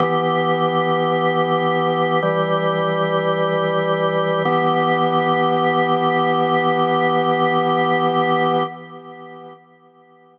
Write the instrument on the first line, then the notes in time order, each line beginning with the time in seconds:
drawbar organ
0.00 E3 B3 G4
2.22 E3 G3 G4
4.45 E3 B3 G4